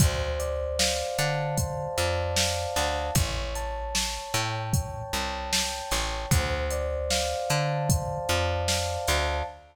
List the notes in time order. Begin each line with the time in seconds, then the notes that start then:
0.00 D2 C5, kick, closed hi-hat
0.39 D5, closed hi-hat
0.79 F5, snare
1.18 D3 A5, closed hi-hat
1.58 C5, kick, closed hi-hat
1.97 F2 D5, closed hi-hat
2.37 F5, snare
2.76 D2 A5, snare, closed hi-hat
3.15 A1 C#5, kick, closed hi-hat
3.55 A5, closed hi-hat
3.95 C#5, snare
4.34 A2 G5, closed hi-hat
4.73 C#5, kick, closed hi-hat
5.13 C2 A5, closed hi-hat
5.53 G5, snare
5.91 A1 C#5, snare, closed hi-hat
6.31 D2 C5, kick, closed hi-hat
6.71 D5, closed hi-hat
7.10 F5, snare
7.50 D3 A5, closed hi-hat
7.89 C5, kick, closed hi-hat
8.29 F2 D5, closed hi-hat
8.68 F5, snare
9.08 D2 A5, snare, closed hi-hat